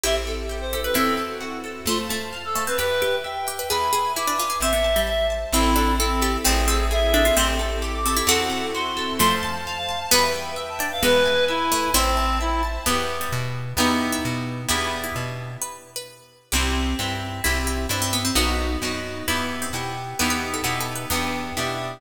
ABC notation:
X:1
M:2/4
L:1/16
Q:1/4=131
K:Am
V:1 name="Clarinet"
e z4 c2 B | A2 z6 | F z4 A2 B | B4 g4 |
b4 d'4 | e4 e2 z2 | E4 C4 | ^G4 e4 |
c' z4 d'2 d' | ^f4 c'4 | (3c'2 a2 a2 a f2 a | b z4 a2 f |
B4 E4 | C4 E2 z2 | [K:Em] z8 | z8 |
z8 | z8 | z8 | z8 |
z8 | z8 | z8 | z8 |]
V:2 name="Harpsichord"
[EG]6 G B | [CE]4 z4 | A,2 A,2 z2 A, C | G2 G2 z2 G B |
^G2 G2 E D F G | C B,2 G,3 z2 | E2 D2 A2 G2 | C2 C2 z2 D F |
[A,C]6 C E | [^FA]4 z4 | [F,A,]8 | [G,B,]6 D z |
[^G,B,]6 A,2 | [CE]4 z4 | [K:Em] B,3 G,3 z2 | G3 E3 z2 |
G3 E3 z2 | B3 B3 z2 | G6 z2 | E2 E2 D C B, C |
B,6 z2 | E3 C3 z2 | B B z A (3F2 A2 B2 | B,4 z4 |]
V:3 name="Orchestral Harp"
C2 A2 G2 A2 | C2 A2 ^F2 A2 | c2 a2 f2 a2 | B2 g2 e2 g2 |
B2 ^g2 e2 g2 | c2 a2 e2 a2 | C2 A2 E2 A2 | C2 A2 ^G2 A2 |
C2 A2 G2 A2 | C2 A2 ^F2 A2 | c2 a2 f2 a2 | B2 g2 e2 g2 |
B2 ^g2 e2 g2 | c2 a2 e2 a2 | [K:Em] [B,EG]8 | [B,^DEG]8 |
[B,DEG]8 | z8 | [CEG]4 [CEG]4 | [CEG]4 [CEG]4 |
[B,^DF]4 [B,DF]4 | [B,EG]4 [B,EG]4 | [B,^DEG]4 [B,DEG]4 | [B,DEG]4 [B,DEG]4 |]
V:4 name="Electric Bass (finger)" clef=bass
A,,,8 | E,,8 | F,,8 | E,,8 |
E,,8 | A,,,8 | A,,,8 | A,,,8 |
A,,,8 | E,,8 | F,,8 | E,,8 |
E,,8 | A,,,8 | [K:Em] E,,4 B,,4 | E,,4 B,,4 |
E,,4 B,,4 | z8 | C,,4 G,,4 | C,,4 G,,4 |
B,,,4 F,,4 | E,,4 B,,4 | E,,4 B,,4 | E,,4 B,,4 |]
V:5 name="String Ensemble 1"
[CEGA]8 | [CE^FA]8 | [cfa]8 | [Beg]8 |
[Be^g]8 | [cea]8 | [CEA]8 | [CE^GA]8 |
[CEGA]8 | [CE^FA]8 | [cfa]8 | [Beg]8 |
[Be^g]8 | [cea]8 | [K:Em] z8 | z8 |
z8 | z8 | z8 | z8 |
z8 | z8 | z8 | z8 |]